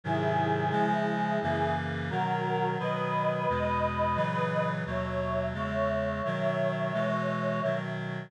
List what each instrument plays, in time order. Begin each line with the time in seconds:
0.04 clarinet G#2 C3 D#3 F#3, choir aahs E4 G#4
0.71 clarinet C#3 F3 G#3
1.42 clarinet F#2 C#3 E3 A#3
2.10 clarinet B2 D#3 F#3, choir aahs F#4 A#4
2.79 clarinet B2 D#3 F#3, choir aahs B4 D#5
3.49 clarinet E2 B2 G#3
4.16 clarinet A#2 C#3 E3 F#3
4.86 clarinet D#2 B2 F#3, choir aahs C#5 E5
5.54 clarinet E2 C#3 G#3, choir aahs C#5 E5
6.25 clarinet B2 D#3 F#3
6.93 clarinet B2 E3 G#3
7.63 clarinet B2 D#3 F#3